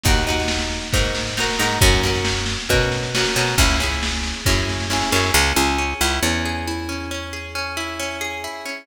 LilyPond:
<<
  \new Staff \with { instrumentName = "Acoustic Guitar (steel)" } { \time 4/4 \key cis \dorian \tempo 4 = 136 <dis' fis' ais'>8 <dis' fis' ais'>4. <dis' fis' ais'>4 <dis' fis' ais'>8 <dis' fis' ais'>8 | <cis' fis' ais'>8 <cis' fis' ais'>4. <cis' fis' ais'>4 <cis' fis' ais'>8 <cis' fis' ais'>8 | <cis' e' gis'>8 <cis' e' gis'>4. <cis' e' gis'>4 <cis' e' gis'>8 <cis' e' gis'>8 | cis'8 gis'8 cis'8 e'8 cis'8 gis'8 e'8 cis'8 |
cis'8 gis'8 cis'8 e'8 cis'8 gis'8 e'8 cis'8 | }
  \new Staff \with { instrumentName = "Electric Bass (finger)" } { \clef bass \time 4/4 \key cis \dorian dis,2 gis,4. gis,8 | fis,2 b,4. b,8 | cis,2 fis,4. fis,8 | cis,8 cis,4 cis,8 e,2~ |
e,1 | }
  \new DrumStaff \with { instrumentName = "Drums" } \drummode { \time 4/4 <bd sn>16 sn16 sn16 sn16 sn16 sn16 sn16 sn16 <bd sn>16 sn16 sn16 sn16 sn16 sn16 sn16 sn16 | <bd sn>16 sn16 sn16 sn16 sn16 sn16 sn16 sn16 <bd sn>16 sn16 sn16 sn16 sn16 sn16 sn16 sn16 | <bd sn>16 sn16 sn16 sn16 sn16 sn16 sn16 sn16 <bd sn>16 sn16 sn16 sn16 sn16 sn16 sn16 sn16 | r4 r4 r4 r4 |
r4 r4 r4 r4 | }
>>